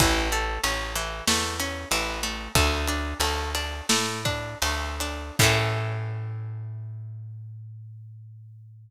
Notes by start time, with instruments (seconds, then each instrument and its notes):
0.00 electric bass (finger) A1, acoustic guitar (steel) E3, kick, ride
0.32 acoustic guitar (steel) A3, ride
0.63 electric bass (finger) A1, acoustic guitar (steel) C#4, ride
0.95 acoustic guitar (steel) E3, ride
1.27 electric bass (finger) E2, acoustic guitar (steel) A3, snare
1.60 acoustic guitar (steel) C#4, ride
1.91 electric bass (finger) A1, acoustic guitar (steel) E3, ride
2.23 acoustic guitar (steel) A3, ride
2.55 electric bass (finger) D2, acoustic guitar (steel) A3, kick, ride
2.87 acoustic guitar (steel) D4, ride
3.20 electric bass (finger) D2, acoustic guitar (steel) A3, ride
3.55 acoustic guitar (steel) D4, ride
3.89 electric bass (finger) A2, acoustic guitar (steel) A3, snare
4.25 acoustic guitar (steel) D4, kick, ride
4.62 electric bass (finger) D2, acoustic guitar (steel) A3, ride
5.00 acoustic guitar (steel) D4, ride
5.39 electric bass (finger) A2, acoustic guitar (steel) A3 C#4, kick, crash
5.43 acoustic guitar (steel) E3